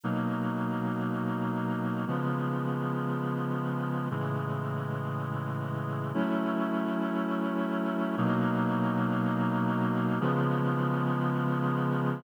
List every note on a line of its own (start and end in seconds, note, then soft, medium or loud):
0.03 2.05 B2 medium
0.03 2.05 F#3 medium
0.03 2.05 A#3 medium
0.03 2.05 D#4 medium
2.07 4.08 C#3 medium
2.07 4.08 F3 medium
2.07 4.08 G#3 medium
2.07 4.08 B3 medium
4.11 6.12 A2 medium
4.11 6.12 C#3 medium
4.11 6.12 E3 medium
4.11 6.12 G#3 medium
6.14 8.15 F#3 medium
6.14 8.15 A3 medium
6.14 8.15 C#4 medium
6.14 8.15 E4 medium
8.17 10.19 B2 loud
8.17 10.19 F#3 loud
8.17 10.19 A#3 medium
8.17 10.19 D#4 medium
10.20 12.22 C#3 loud
10.20 12.22 F3 loud
10.20 12.22 G#3 medium
10.20 12.22 B3 medium